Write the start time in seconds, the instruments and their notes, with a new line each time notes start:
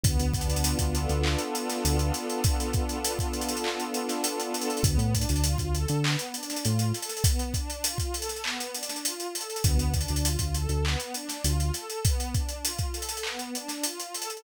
0.04 synth bass 1 D2, pad 2 (warm) B3, kick, closed hi-hat
0.20 synth bass 1 D2, closed hi-hat
0.34 pad 2 (warm) D4, kick, closed hi-hat
0.41 closed hi-hat
0.48 synth bass 1 D2, closed hi-hat
0.56 closed hi-hat
0.64 pad 2 (warm) F4, closed hi-hat
0.79 synth bass 1 D2, kick, closed hi-hat
0.94 pad 2 (warm) A4, closed hi-hat
1.09 synth bass 1 D2, closed hi-hat
1.24 pad 2 (warm) B3, clap
1.39 closed hi-hat
1.54 pad 2 (warm) D4, closed hi-hat
1.70 snare, closed hi-hat
1.84 synth bass 1 D2, pad 2 (warm) F4, closed hi-hat
1.99 closed hi-hat
2.14 pad 2 (warm) A4, snare, closed hi-hat
2.29 closed hi-hat
2.44 pad 2 (warm) B3, kick, closed hi-hat
2.60 closed hi-hat
2.73 pad 2 (warm) D4, kick, closed hi-hat
2.89 closed hi-hat
3.04 pad 2 (warm) F4, closed hi-hat
3.19 kick, closed hi-hat
3.33 pad 2 (warm) A4, closed hi-hat
3.41 closed hi-hat
3.49 closed hi-hat
3.57 closed hi-hat
3.64 pad 2 (warm) B3, clap
3.80 closed hi-hat
3.94 pad 2 (warm) D4, closed hi-hat
4.09 snare, closed hi-hat
4.24 pad 2 (warm) F4, closed hi-hat
4.40 closed hi-hat
4.54 pad 2 (warm) A4, closed hi-hat
4.62 closed hi-hat
4.70 closed hi-hat
4.77 closed hi-hat
4.83 synth bass 1 D2, pad 2 (warm) B3, kick, closed hi-hat
4.98 synth bass 1 A2, closed hi-hat
5.14 pad 2 (warm) D4, kick, closed hi-hat
5.21 closed hi-hat
5.29 synth bass 1 D2, closed hi-hat
5.36 closed hi-hat
5.44 pad 2 (warm) F4, closed hi-hat
5.58 synth bass 1 D2, kick, closed hi-hat
5.74 pad 2 (warm) A4, closed hi-hat
5.88 synth bass 1 D3, closed hi-hat
6.04 pad 2 (warm) B3, clap
6.19 closed hi-hat
6.34 pad 2 (warm) D4, closed hi-hat
6.43 closed hi-hat
6.50 snare, closed hi-hat
6.57 closed hi-hat
6.64 synth bass 1 A2, pad 2 (warm) F4, closed hi-hat
6.79 closed hi-hat
6.94 pad 2 (warm) A4, snare, closed hi-hat
7.02 closed hi-hat
7.09 snare, closed hi-hat
7.17 closed hi-hat
7.24 pad 2 (warm) B3, kick, closed hi-hat
7.39 closed hi-hat
7.54 pad 2 (warm) D4, kick, closed hi-hat
7.70 closed hi-hat
7.84 pad 2 (warm) F4, closed hi-hat
7.98 kick, closed hi-hat
8.14 pad 2 (warm) A4, closed hi-hat
8.22 closed hi-hat
8.29 snare, closed hi-hat
8.36 closed hi-hat
8.44 pad 2 (warm) B3, clap
8.60 closed hi-hat
8.74 pad 2 (warm) D4, closed hi-hat
8.83 closed hi-hat
8.89 snare, closed hi-hat
8.96 closed hi-hat
9.04 pad 2 (warm) F4, closed hi-hat
9.20 closed hi-hat
9.34 pad 2 (warm) A4, closed hi-hat
9.41 closed hi-hat
9.50 closed hi-hat
9.56 closed hi-hat
9.64 synth bass 1 D2, pad 2 (warm) B3, kick, closed hi-hat
9.78 synth bass 1 D2, closed hi-hat
9.94 pad 2 (warm) D4, kick, closed hi-hat
10.01 closed hi-hat
10.08 synth bass 1 D2, closed hi-hat
10.16 closed hi-hat
10.24 pad 2 (warm) F4, closed hi-hat
10.39 synth bass 1 D2, kick, closed hi-hat
10.54 pad 2 (warm) A4, closed hi-hat
10.69 synth bass 1 D2, closed hi-hat
10.84 pad 2 (warm) B3, clap
11.00 closed hi-hat
11.14 pad 2 (warm) D4, closed hi-hat
11.29 snare, closed hi-hat
11.44 synth bass 1 D2, pad 2 (warm) F4, closed hi-hat
11.60 closed hi-hat
11.73 pad 2 (warm) A4, snare, closed hi-hat
11.90 closed hi-hat
12.04 pad 2 (warm) B3, kick, closed hi-hat
12.20 closed hi-hat
12.34 pad 2 (warm) D4, kick, closed hi-hat
12.49 closed hi-hat
12.64 pad 2 (warm) F4, closed hi-hat
12.79 kick, closed hi-hat
12.94 pad 2 (warm) A4, closed hi-hat
13.02 closed hi-hat
13.09 closed hi-hat
13.17 closed hi-hat
13.23 pad 2 (warm) B3, clap
13.39 closed hi-hat
13.54 pad 2 (warm) D4, closed hi-hat
13.68 snare, closed hi-hat
13.84 pad 2 (warm) F4, closed hi-hat
14.00 closed hi-hat
14.14 pad 2 (warm) A4, closed hi-hat
14.22 closed hi-hat
14.30 closed hi-hat
14.37 closed hi-hat